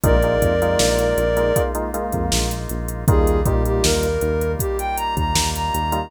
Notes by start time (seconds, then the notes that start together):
0.03 A#1 G#3 A#3 D#4 F4 A#4 D5, kick, closed hi-hat
0.22 G#3 A#3 D#4 F4, closed hi-hat
0.42 F2, kick, closed hi-hat
0.62 G#3 A#3 D#4 F4, closed hi-hat
0.79 A#1, snare
0.99 closed hi-hat
1.17 A#1, closed hi-hat
1.36 G#3 A#3 D#4 F4, closed hi-hat
1.56 G#3 A#3 D#4 F4, kick, closed hi-hat
1.75 G#3 A#3 D#4 F4, closed hi-hat
1.94 G#3 A#3 D#4 F4, closed hi-hat
2.12 F2, kick, closed hi-hat
2.32 A#1, snare
2.51 closed hi-hat
2.69 A#1, closed hi-hat
2.88 closed hi-hat
3.08 D#2 G3 A#3 D#4 F4 G#4, kick, closed hi-hat
3.27 closed hi-hat
3.44 A#2 G3 A#3 D#4 F4 G4, kick, closed hi-hat
3.65 G4, closed hi-hat
3.83 D#2 A#4, snare
4.03 closed hi-hat
4.21 D#2, closed hi-hat
4.41 closed hi-hat
4.59 G4, kick, closed hi-hat
4.78 G5, closed hi-hat
4.97 A#5, closed hi-hat
5.17 D#2 A#5, kick, closed hi-hat
5.35 D#2, snare
5.55 A#5, closed hi-hat
5.74 D#2, closed hi-hat
5.92 G3 A#3 D#4 F4, closed hi-hat